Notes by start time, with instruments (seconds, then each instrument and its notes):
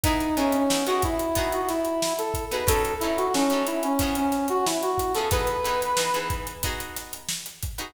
0.04 acoustic guitar (steel) B3 D#4 E4 G#4, brass section D#4, kick, closed hi-hat
0.20 closed hi-hat
0.37 acoustic guitar (steel) B3 D#4 E4 G#4, brass section C#4, closed hi-hat
0.52 brass section C#4, closed hi-hat
0.70 acoustic guitar (steel) B3 D#4 E4 G#4, snare
0.86 acoustic guitar (steel) B3 D#4 E4 G#4, brass section F#4, snare, closed hi-hat
1.02 brass section E4, kick, snare, closed hi-hat
1.19 closed hi-hat
1.35 acoustic guitar (steel) B3 D#4 F#4 G#4, kick, closed hi-hat
1.52 brass section F#4, closed hi-hat
1.69 brass section E4, snare, closed hi-hat
1.85 closed hi-hat
2.02 snare
2.18 brass section A4, closed hi-hat
2.34 kick, closed hi-hat
2.51 acoustic guitar (steel) B3 D#4 F#4 G#4, brass section B4, closed hi-hat
2.67 acoustic guitar (steel) F#3 C#4 D#4 A4, brass section A4, kick, closed hi-hat
2.85 closed hi-hat
3.00 acoustic guitar (steel) F#3 C#4 D#4 A4, brass section E4, closed hi-hat
3.17 brass section F#4, closed hi-hat
3.34 acoustic guitar (steel) F#3 C#4 D#4 A4, brass section C#4, snare
3.50 acoustic guitar (steel) F#3 C#4 D#4 A4, closed hi-hat
3.66 brass section E4, snare, closed hi-hat
3.83 brass section C#4, closed hi-hat
3.99 acoustic guitar (steel) F3 B3 C#4 G#4, kick, closed hi-hat
4.15 brass section C#4, closed hi-hat
4.32 snare, closed hi-hat
4.48 brass section F#4, closed hi-hat
4.66 brass section E4, snare
4.82 brass section F#4, closed hi-hat
4.98 kick, snare, closed hi-hat
5.15 acoustic guitar (steel) F3 B3 C#4 G#4, brass section A4, closed hi-hat
5.31 acoustic guitar (steel) E3 B3 D#4 G#4, brass section B4, kick, closed hi-hat
5.47 closed hi-hat
5.64 acoustic guitar (steel) E3 B3 D#4 G#4, closed hi-hat
5.81 snare, closed hi-hat
5.97 acoustic guitar (steel) E3 B3 D#4 G#4, snare
6.14 acoustic guitar (steel) E3 B3 D#4 G#4, closed hi-hat
6.30 kick, snare, closed hi-hat
6.47 closed hi-hat
6.63 acoustic guitar (steel) B3 D#4 F#4 G#4, kick, closed hi-hat
6.80 closed hi-hat
6.96 snare, closed hi-hat
7.13 closed hi-hat
7.29 snare
7.46 snare, closed hi-hat
7.63 kick, closed hi-hat
7.78 acoustic guitar (steel) B3 D#4 F#4 G#4, closed hi-hat